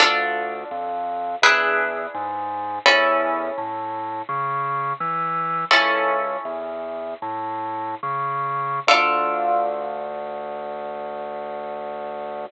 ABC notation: X:1
M:4/4
L:1/8
Q:1/4=84
K:Dm
V:1 name="Orchestral Harp"
[DFA]4 [DE^G=B]4 | [^CEA]8 | "^rit." [^CEA]8 | [DFA]8 |]
V:2 name="Drawbar Organ" clef=bass
D,,2 F,,2 E,,2 ^G,,2 | E,,2 A,,2 ^C,2 E,2 | "^rit." ^C,,2 E,,2 A,,2 ^C,2 | D,,8 |]